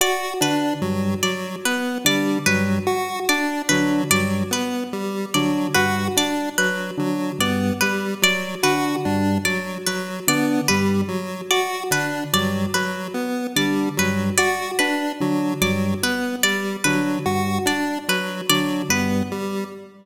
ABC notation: X:1
M:3/4
L:1/8
Q:1/4=73
K:none
V:1 name="Drawbar Organ" clef=bass
z D, G,, z2 D, | G,, z2 D, G,, z | z D, G,, z2 D, | G,, z2 D, G,, z |
z D, G,, z2 D, | G,, z2 D, G,, z | z D, G,, z2 D, | G,, z2 D, G,, z |]
V:2 name="Lead 1 (square)"
^F D ^F, F, B, G, | ^F, ^F D F, F, B, | G, ^F, ^F D F, F, | B, G, ^F, ^F D F, |
^F, B, G, F, ^F D | ^F, F, B, G, F, ^F | D ^F, F, B, G, F, | ^F D ^F, F, B, G, |]
V:3 name="Harpsichord"
d B z d B d | B z d B d B | z d B d B z | d B d B z d |
B d B z d B | d B z d B d | B z d B d B | z d B d B z |]